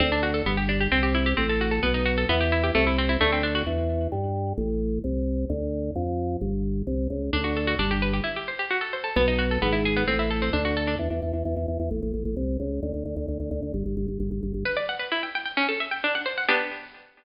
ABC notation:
X:1
M:2/2
L:1/8
Q:1/2=131
K:G
V:1 name="Harpsichord"
C D F A B, G D G | C G E G C A F A | B, ^D F A B, G E G | A, E C E A, C D F |
[K:C] z8 | z8 | z8 | z8 |
[K:G] D F A F D G B G | E G c G F A c A | B, ^D F A B, E ^G B, | C E A C D F A D |
[K:C] z8 | z8 | z8 | z8 |
[K:G] B d f B E g g g | ^C A e g D f =c f | [B,DG]8 |]
V:2 name="Drawbar Organ" clef=bass
D,,4 G,,,4 | C,,4 A,,,4 | B,,,4 E,,4 | C,,4 D,,4 |
[K:C] E,,4 G,,4 | A,,,4 C,,4 | D,,4 F,,4 | G,,,4 C,,2 ^C,,2 |
[K:G] D,,4 G,,,4 | z8 | B,,,4 ^G,,,4 | A,,,4 D,,4 |
[K:C] E,, E,, E,, E,, E,, E,, E,, E,, | A,,, A,,, A,,, A,,, C,,2 ^C,,2 | D,, D,, D,, D,, D,, D,, D,, D,, | G,,, G,,, G,,, G,,, G,,, G,,, G,,, G,,, |
[K:G] z8 | z8 | z8 |]